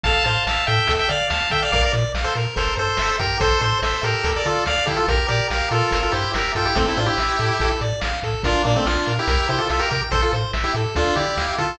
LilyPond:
<<
  \new Staff \with { instrumentName = "Lead 1 (square)" } { \time 4/4 \key f \major \tempo 4 = 143 <f'' a''>8 <f'' a''>8 <f'' a''>8 <e'' g''>8. <e'' g''>16 <d'' f''>8 <f'' a''>8 <e'' g''>16 <d'' f''>16 | <d'' f''>16 <bes' d''>16 r8. <a' c''>16 r8 <a' c''>8 <a' c''>4 <g' bes'>8 | <a' c''>8 <a' c''>8 <a' c''>8 <g' bes'>8. <bes' d''>16 <f' a'>8 <d'' f''>8 <e' g'>16 <f' a'>16 | <g' bes'>8 <g' bes'>8 <g' bes'>8 <f' a'>8. <f' a'>16 <e' g'>8 <g' bes'>8 <f' a'>16 <e' g'>16 |
<a c'>16 <c' e'>16 <d' f'>16 <e' g'>4.~ <e' g'>16 r4. | <d' f'>8 <bes d'>16 <a c'>16 <d' f'>8. <e' g'>8. <e' g'>16 <f' a'>16 <f' a'>16 <g' bes'>16 <g' bes'>16 r16 | <a' c''>16 <f' a'>16 r8. <e' g'>16 r8 <d' f'>8 <e' g'>4 <f' a'>8 | }
  \new Staff \with { instrumentName = "Lead 1 (square)" } { \time 4/4 \key f \major a'8 c''8 e''8 a'8 a'8 d''8 f''8 a'8 | bes'8 d''8 f''8 bes'8 bes'8 c''8 e''8 g''8 | a'8 c''8 e''8 a'8 a'8 d''8 f''8 a'8 | bes'8 d''8 f''8 bes'8 bes'8 c''8 e''8 g''8 |
a'8 c''8 e''8 a'8 a'8 d''8 f''8 a'8 | bes'8 d''8 f''8 bes'8 bes'8 c''8 e''8 g''8 | a'8 c''8 e''8 a'8 a'8 d''8 f''8 a'8 | }
  \new Staff \with { instrumentName = "Synth Bass 1" } { \clef bass \time 4/4 \key f \major a,,8 a,8 a,,8 a,8 d,8 d8 d,8 d8 | bes,,8 bes,8 bes,,8 bes,8 g,,8 g,8 g,,8 g,8 | a,,8 a,8 a,,8 a,8 d,8 d8 d,8 d8 | bes,,8 bes,8 bes,,8 bes,8 g,,8 g,8 g,,8 g,8 |
a,,8 a,8 a,,8 a,8 a,,8 a,8 a,,8 a,8 | bes,,8 bes,8 bes,,8 bes,8 c,8 c8 c,8 c8 | a,,8 a,8 a,,8 a,8 d,8 d8 d,8 d8 | }
  \new DrumStaff \with { instrumentName = "Drums" } \drummode { \time 4/4 <hh bd>8 hh8 sn8 hh8 <hh bd>8 hh8 sn8 <hh bd>8 | <hh bd>8 hh8 sn8 hh8 <hh bd>8 hh8 sn8 <hh bd>8 | <hh bd>8 hh8 sn8 hh8 <hh bd>8 hh8 sn8 <hh bd>8 | <hh bd>8 hh8 sn8 hh8 <hh bd>8 hh8 sn8 <hh bd>8 |
<hh bd>8 hh8 sn8 hh8 <hh bd>8 hh8 sn8 <hh bd>8 | <hh bd>8 hh8 sn8 hh8 <hh bd>8 hh8 sn8 <hh bd>8 | <hh bd>8 hh8 sn8 hh8 <hh bd>8 hh8 sn8 <hh bd>8 | }
>>